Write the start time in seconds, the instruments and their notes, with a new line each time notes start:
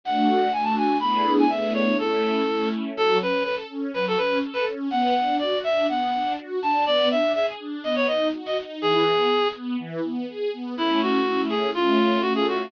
0.04 string ensemble 1 A3 D4 F#4, clarinet F#5
0.53 string ensemble 1 A3 D4 F#4, clarinet G#5
0.64 clarinet A5
0.77 clarinet G#5
1.00 string ensemble 1 A3 B3 D4 E4 G#4, clarinet B5
1.39 clarinet G#5
1.49 string ensemble 1 A3 B3 D4 E4 G#4, clarinet E5
1.74 clarinet C#5
1.98 string ensemble 1 A3 C#4 E4, clarinet A4
2.47 string ensemble 1 A3 C#4 E4
2.96 string ensemble 1 F#3, clarinet A4
3.20 string ensemble 1 C#4, clarinet B4
3.44 string ensemble 1 A4, clarinet B4
3.70 string ensemble 1 C#4
3.94 string ensemble 1 F#3, clarinet B4
4.08 clarinet A4
4.17 string ensemble 1 C#4, clarinet B4
4.42 string ensemble 1 A4
4.53 clarinet B4
4.67 string ensemble 1 C#4
4.91 string ensemble 1 B3, clarinet F#5
5.16 string ensemble 1 D4
5.39 string ensemble 1 F#4, clarinet D5
5.64 string ensemble 1 D4, clarinet E5
5.89 string ensemble 1 B3, clarinet F#5
6.14 string ensemble 1 D4
6.38 string ensemble 1 F#4
6.62 string ensemble 1 D4, clarinet A5
6.86 string ensemble 1 B3, clarinet D5
7.11 string ensemble 1 D4, clarinet E5
7.34 string ensemble 1 G#4, clarinet E5
7.60 string ensemble 1 D4
7.84 string ensemble 1 B3, clarinet D#5
7.96 clarinet C#5
8.07 string ensemble 1 D#4, clarinet D#5
8.33 string ensemble 1 F#4
8.46 clarinet D#5
8.57 string ensemble 1 D#4
8.81 string ensemble 1 E3, clarinet G#4
9.06 string ensemble 1 B3
9.30 string ensemble 1 G#4
9.55 string ensemble 1 B3
9.79 string ensemble 1 E3
10.04 string ensemble 1 B3
10.28 string ensemble 1 G#4
10.53 string ensemble 1 B3
10.76 string ensemble 1 A3 C#4 E4, clarinet E4
11.02 clarinet F#4
11.25 string ensemble 1 A3 C#4 E4
11.49 clarinet G#4
11.74 string ensemble 1 A3 C#4 F4, clarinet F4
12.21 string ensemble 1 A3 C#4 F4, clarinet F#4
12.35 clarinet G#4
12.48 clarinet F#4